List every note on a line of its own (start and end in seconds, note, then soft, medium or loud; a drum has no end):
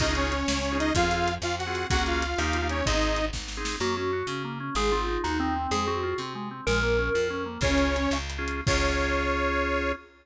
0.00 0.43 C#2 medium
0.00 0.06 C#4 medium
0.00 0.06 D#4 medium
0.00 0.13 D#4 medium
0.00 0.06 F4 medium
0.00 0.06 G#4 medium
0.00 0.13 D#5 loud
0.00 kick medium
0.00 crash loud
0.08 0.34 C#4 medium
0.08 0.34 D#4 medium
0.08 0.34 F4 medium
0.08 0.34 G#4 medium
0.15 0.78 C#4 medium
0.15 0.78 C#5 medium
0.15 closed hi-hat medium
0.32 closed hi-hat medium
0.48 0.92 C#2 medium
0.48 snare loud
0.65 closed hi-hat medium
0.72 0.91 C#4 medium
0.72 0.91 D#4 medium
0.72 0.91 F4 medium
0.72 0.91 G#4 medium
0.79 0.93 D#4 medium
0.79 0.93 D#5 loud
0.79 closed hi-hat medium
0.95 1.38 F2 medium
0.95 1.02 C4 medium
0.95 1.34 F4 medium
0.95 1.02 F4 loud
0.95 1.02 G#4 medium
0.95 1.34 F5 loud
0.95 kick medium
0.95 closed hi-hat medium
1.03 1.29 C4 medium
1.03 1.29 F4 medium
1.03 1.29 G#4 medium
1.11 closed hi-hat medium
1.28 closed hi-hat medium
1.42 1.85 F2 medium
1.42 1.56 F4 medium
1.42 1.56 F5 medium
1.42 cross-stick medium
1.59 1.87 F#4 medium
1.59 1.87 F#5 medium
1.59 closed hi-hat medium
1.67 1.86 C4 medium
1.67 1.86 F4 medium
1.67 1.86 G#4 medium
1.75 closed hi-hat medium
1.90 2.34 C#2 medium
1.90 1.97 A#3 medium
1.90 1.97 C#4 medium
1.90 1.97 F#4 loud
1.90 2.03 F#4 loud
1.90 1.97 G#4 medium
1.90 2.03 F#5 loud
1.90 kick medium
1.90 closed hi-hat medium
1.98 2.24 A#3 medium
1.98 2.24 C#4 medium
1.98 2.24 F#4 medium
1.98 2.24 G#4 medium
2.06 2.68 F4 medium
2.06 2.68 F5 medium
2.06 closed hi-hat medium
2.22 closed hi-hat medium
2.38 2.82 D#2 medium
2.38 2.58 A#3 medium
2.38 2.58 D#4 medium
2.38 2.58 G4 medium
2.38 cross-stick medium
2.53 closed hi-hat medium
2.62 2.81 A#3 medium
2.62 2.81 D#4 medium
2.62 2.81 G4 medium
2.69 2.86 C#4 medium
2.69 2.86 C#5 medium
2.69 closed hi-hat medium
2.86 3.30 G#1 medium
2.86 2.93 C4 loud
2.86 3.25 D#4 medium
2.86 2.93 D#4 medium
2.86 2.93 G#4 medium
2.86 3.25 D#5 loud
2.86 kick medium
2.86 closed hi-hat medium
2.94 3.19 C4 medium
2.94 3.19 D#4 medium
2.94 3.19 G#4 medium
3.02 closed hi-hat medium
3.16 closed hi-hat medium
3.33 3.77 G#1 medium
3.33 kick medium
3.33 snare medium
3.48 snare medium
3.57 3.76 C4 medium
3.57 3.76 D#4 medium
3.57 3.76 G#4 medium
3.65 snare medium
3.80 4.23 F#2 medium
3.80 3.95 A#3 loud
3.80 3.96 F#4 medium
3.97 4.11 C#4 medium
3.97 4.27 F#4 medium
4.13 4.27 F#4 medium
4.27 4.70 C#3 medium
4.27 4.43 C#4 medium
4.44 4.59 A#3 medium
4.60 4.74 C#4 medium
4.75 5.18 G#1 medium
4.75 4.91 G#3 loud
4.75 4.91 G#4 medium
4.92 5.06 C4 medium
4.92 5.20 F4 medium
5.08 5.22 D#4 medium
5.24 5.67 D#2 medium
5.24 5.37 D#4 medium
5.24 5.38 F#4 medium
5.40 5.71 C4 medium
5.40 5.54 D#4 medium
5.56 5.70 C4 medium
5.71 6.14 F2 medium
5.71 5.86 G#3 loud
5.71 5.84 G#4 medium
5.87 6.01 C4 medium
5.87 6.17 F#4 medium
6.03 6.17 F4 medium
6.18 6.61 C3 medium
6.18 6.33 C4 medium
6.35 6.49 G#3 medium
6.51 6.65 C4 medium
6.67 7.10 A#1 medium
6.67 6.81 G#3 loud
6.67 7.27 A#4 medium
6.83 6.97 A#3 medium
6.99 7.13 C#4 medium
7.14 7.58 F2 medium
7.14 7.29 F4 medium
7.30 7.45 C#4 medium
7.46 7.60 A#3 medium
7.61 8.07 C#2 loud
7.61 8.18 C#4 loud
7.61 7.68 C#4 medium
7.61 7.68 F4 medium
7.61 7.68 G#4 medium
7.61 8.18 C#5 loud
7.61 kick loud
7.61 crash medium
7.70 7.97 C#4 medium
7.70 7.97 F4 medium
7.70 7.97 G#4 medium
7.78 closed hi-hat medium
7.96 closed hi-hat medium
8.11 8.62 C#2 medium
8.11 cross-stick medium
8.30 closed hi-hat medium
8.38 8.61 C#4 medium
8.38 8.61 F4 medium
8.38 8.61 G#4 medium
8.48 closed hi-hat medium
8.67 9.93 C#2 medium
8.67 9.92 C#4 loud
8.67 9.92 F4 loud
8.67 9.92 G#4 loud
8.67 9.92 C#5 loud
8.67 kick loud
8.67 crash loud